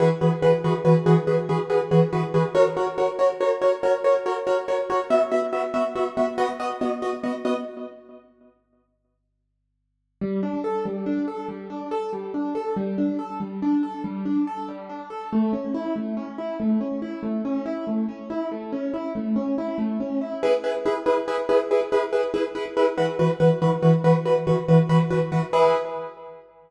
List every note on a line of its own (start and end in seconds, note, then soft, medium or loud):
0.00 0.09 E3 loud
0.00 0.09 F#4 medium
0.00 0.09 G#4 medium
0.00 0.09 B4 medium
0.21 0.30 E3 medium
0.21 0.30 F#4 medium
0.21 0.30 G#4 medium
0.21 0.30 B4 medium
0.42 0.51 E3 medium
0.42 0.51 F#4 medium
0.42 0.51 G#4 medium
0.42 0.51 B4 medium
0.64 0.73 E3 medium
0.64 0.73 F#4 medium
0.64 0.73 G#4 medium
0.64 0.73 B4 medium
0.85 0.93 E3 medium
0.85 0.93 F#4 medium
0.85 0.93 G#4 medium
0.85 0.93 B4 medium
1.06 1.15 E3 medium
1.06 1.15 F#4 medium
1.06 1.15 G#4 medium
1.06 1.15 B4 medium
1.27 1.36 E3 medium
1.27 1.36 F#4 medium
1.27 1.36 G#4 medium
1.27 1.36 B4 medium
1.49 1.58 E3 medium
1.49 1.58 F#4 medium
1.49 1.58 G#4 medium
1.49 1.58 B4 medium
1.70 1.78 E3 medium
1.70 1.78 F#4 medium
1.70 1.78 G#4 medium
1.70 1.78 B4 medium
1.91 2.00 E3 medium
1.91 2.00 F#4 medium
1.91 2.00 G#4 medium
1.91 2.00 B4 medium
2.13 2.21 E3 medium
2.13 2.21 F#4 medium
2.13 2.21 G#4 medium
2.13 2.21 B4 medium
2.34 2.43 E3 medium
2.34 2.43 F#4 medium
2.34 2.43 G#4 medium
2.34 2.43 B4 medium
2.55 2.63 F#4 medium
2.55 2.63 A#4 medium
2.55 2.63 C#5 medium
2.77 2.85 F#4 medium
2.77 2.85 A#4 medium
2.77 2.85 C#5 medium
2.98 3.06 F#4 medium
2.98 3.06 A#4 medium
2.98 3.06 C#5 medium
3.19 3.27 F#4 medium
3.19 3.27 A#4 medium
3.19 3.27 C#5 medium
3.41 3.49 F#4 medium
3.41 3.49 A#4 medium
3.41 3.49 C#5 medium
3.62 3.70 F#4 medium
3.62 3.70 A#4 medium
3.62 3.70 C#5 medium
3.83 3.92 F#4 medium
3.83 3.92 A#4 medium
3.83 3.92 C#5 medium
4.04 4.13 F#4 medium
4.04 4.13 A#4 medium
4.04 4.13 C#5 medium
4.26 4.34 F#4 medium
4.26 4.34 A#4 medium
4.26 4.34 C#5 medium
4.47 4.55 F#4 medium
4.47 4.55 A#4 medium
4.47 4.55 C#5 medium
4.68 4.77 F#4 medium
4.68 4.77 A#4 medium
4.68 4.77 C#5 medium
4.90 4.98 F#4 medium
4.90 4.98 A#4 medium
4.90 4.98 C#5 medium
5.10 5.19 B3 medium
5.10 5.19 F#4 medium
5.10 5.19 E5 medium
5.31 5.40 B3 medium
5.31 5.40 F#4 medium
5.31 5.40 E5 medium
5.53 5.61 B3 medium
5.53 5.61 F#4 medium
5.53 5.61 E5 medium
5.74 5.82 B3 medium
5.74 5.82 F#4 medium
5.74 5.82 E5 medium
5.95 6.04 B3 medium
5.95 6.04 F#4 medium
5.95 6.04 E5 medium
6.17 6.26 B3 medium
6.17 6.26 F#4 medium
6.17 6.26 E5 medium
6.38 6.46 B3 loud
6.38 6.46 F#4 medium
6.38 6.46 D#5 loud
6.60 6.68 B3 medium
6.60 6.68 F#4 medium
6.60 6.68 D#5 medium
6.81 6.90 B3 medium
6.81 6.90 F#4 medium
6.81 6.90 D#5 medium
7.02 7.11 B3 medium
7.02 7.11 F#4 medium
7.02 7.11 D#5 medium
7.23 7.32 B3 medium
7.23 7.32 F#4 medium
7.23 7.32 D#5 medium
7.45 7.53 B3 medium
7.45 7.53 F#4 medium
7.45 7.53 D#5 medium
10.21 10.41 G3 medium
10.43 10.62 D4 medium
10.64 10.83 A4 medium
10.85 11.05 G3 medium
11.06 11.25 D4 medium
11.28 11.47 A4 medium
11.48 11.68 G3 medium
11.70 11.89 D4 medium
11.91 12.10 A4 medium
12.13 12.32 G3 medium
12.34 12.53 D4 medium
12.55 12.74 A4 medium
12.76 12.96 G3 medium
12.98 13.17 D4 medium
13.19 13.38 A4 medium
13.40 13.59 G3 medium
13.62 13.81 D4 medium
13.83 14.02 A4 medium
14.04 14.23 G3 medium
14.25 14.45 D4 medium
14.47 14.66 A4 medium
14.68 14.88 G3 medium
14.89 15.09 D4 medium
15.10 15.29 A4 medium
15.33 15.52 A3 medium
15.53 15.72 C#4 medium
15.74 15.94 E4 medium
15.96 16.15 A3 medium
16.17 16.36 C#4 medium
16.38 16.57 E4 medium
16.60 16.79 A3 medium
16.81 17.00 C#4 medium
17.02 17.21 E4 medium
17.23 17.42 A3 medium
17.45 17.64 C#4 medium
17.66 17.85 E4 medium
17.87 18.06 A3 medium
18.09 18.28 C#4 medium
18.30 18.49 E4 medium
18.52 18.71 A3 medium
18.73 18.92 C#4 medium
18.94 19.13 E4 medium
19.15 19.34 A3 medium
19.36 19.55 C#4 medium
19.58 19.77 E4 medium
19.78 19.97 A3 medium
20.00 20.19 C#4 medium
20.21 20.40 E4 medium
20.43 20.51 E4 medium
20.43 20.51 G#4 loud
20.43 20.51 B4 medium
20.64 20.72 E4 medium
20.64 20.72 G#4 medium
20.64 20.72 B4 medium
20.86 20.94 E4 medium
20.86 20.94 G#4 medium
20.86 20.94 B4 medium
21.06 21.15 E4 medium
21.06 21.15 G#4 medium
21.06 21.15 B4 medium
21.28 21.36 E4 medium
21.28 21.36 G#4 medium
21.28 21.36 B4 medium
21.49 21.58 E4 medium
21.49 21.58 G#4 medium
21.49 21.58 B4 medium
21.71 21.79 E4 medium
21.71 21.79 G#4 medium
21.71 21.79 B4 medium
21.92 22.01 E4 medium
21.92 22.01 G#4 medium
21.92 22.01 B4 medium
22.13 22.21 E4 medium
22.13 22.21 G#4 medium
22.13 22.21 B4 medium
22.34 22.42 E4 medium
22.34 22.42 G#4 medium
22.34 22.42 B4 medium
22.55 22.63 E4 medium
22.55 22.63 G#4 medium
22.55 22.63 B4 medium
22.77 22.85 E4 medium
22.77 22.85 G#4 medium
22.77 22.85 B4 medium
22.98 23.06 E3 loud
22.98 23.06 F#4 medium
22.98 23.06 B4 medium
23.19 23.28 E3 medium
23.19 23.28 F#4 medium
23.19 23.28 B4 medium
23.40 23.48 E3 medium
23.40 23.48 F#4 medium
23.40 23.48 B4 medium
23.62 23.70 E3 medium
23.62 23.70 F#4 medium
23.62 23.70 B4 medium
23.82 23.91 E3 medium
23.82 23.91 F#4 medium
23.82 23.91 B4 medium
24.04 24.13 E3 medium
24.04 24.13 F#4 medium
24.04 24.13 B4 medium
24.25 24.34 E3 medium
24.25 24.34 F#4 medium
24.25 24.34 B4 medium
24.47 24.55 E3 medium
24.47 24.55 F#4 medium
24.47 24.55 B4 medium
24.68 24.77 E3 medium
24.68 24.77 F#4 medium
24.68 24.77 B4 medium
24.89 24.98 E3 medium
24.89 24.98 F#4 medium
24.89 24.98 B4 medium
25.10 25.19 E3 medium
25.10 25.19 F#4 medium
25.10 25.19 B4 medium
25.32 25.40 E3 medium
25.32 25.40 F#4 medium
25.32 25.40 B4 medium
25.53 25.75 E4 medium
25.53 25.75 G#4 loud
25.53 25.75 B4 loud